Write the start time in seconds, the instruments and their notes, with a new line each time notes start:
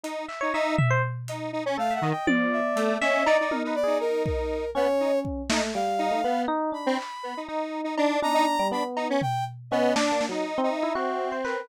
0.04 lead 1 (square) D#4, closed hi-hat
0.29 electric piano 1 E5, clap
0.41 lead 1 (square) D#4, electric piano 1 C#5
0.54 lead 1 (square) D#4, electric piano 1 E5
0.78 electric piano 1 E5, floor tom
0.90 electric piano 1 C5
1.28 lead 1 (square) D#4, closed hi-hat
1.53 lead 1 (square) D#4
1.66 lead 1 (square) C#4
1.78 lead 1 (square) A3, electric piano 1 A4, brass section F5
1.91 electric piano 1 E5, brass section F#5
2.01 lead 1 (square) D#3, electric piano 1 D#5
2.11 brass section G5
2.27 lead 1 (square) F3, electric piano 1 D5, high tom
2.53 brass section E5
2.76 lead 1 (square) A3, closed hi-hat
3.01 lead 1 (square) C#4, brass section D#5, electric piano 1 E5, snare
3.26 lead 1 (square) D#4, electric piano 1 D5, cowbell
3.40 lead 1 (square) D#4
3.51 electric piano 1 A#4, high tom
3.64 lead 1 (square) D#4, electric piano 1 B4
3.75 brass section D5
3.84 lead 1 (square) D#4, electric piano 1 G#4
4.00 brass section A#4
4.26 brass section A#4, kick
4.75 lead 1 (square) B3, electric piano 1 C#4, brass section C#5
5.00 lead 1 (square) D#4
5.25 kick
5.50 electric piano 1 A3, lead 1 (square) D#4, snare
5.74 electric piano 1 G3, brass section F5, closed hi-hat
5.99 lead 1 (square) D#4, closed hi-hat
6.11 electric piano 1 A3
6.24 lead 1 (square) B3, electric piano 1 B3
6.48 electric piano 1 D#4
6.72 electric piano 1 D4, brass section B5
6.86 lead 1 (square) C4
6.98 clap
7.23 lead 1 (square) B3
7.37 lead 1 (square) D#4
7.48 lead 1 (square) D#4, electric piano 1 D#4
7.84 lead 1 (square) D#4
7.98 lead 1 (square) D4, cowbell
8.22 electric piano 1 D4, lead 1 (square) D#4, brass section A#5, high tom
8.34 lead 1 (square) D#4
8.59 electric piano 1 G3
8.71 electric piano 1 B3, lead 1 (square) D4, brass section B5
8.97 lead 1 (square) D#4, cowbell
9.10 lead 1 (square) C#4
9.22 brass section G5, floor tom
9.71 lead 1 (square) B3, electric piano 1 C#4, brass section D#5
9.96 lead 1 (square) D4, electric piano 1 D4, snare
10.12 electric piano 1 A#3
10.21 snare
10.29 electric piano 1 F#3, lead 1 (square) D#4
10.58 electric piano 1 C4
10.63 lead 1 (square) D#4
10.70 brass section E5
10.83 electric piano 1 E4
10.95 lead 1 (square) C4, electric piano 1 F#4
11.32 electric piano 1 C5
11.45 brass section A#4, electric piano 1 B4, clap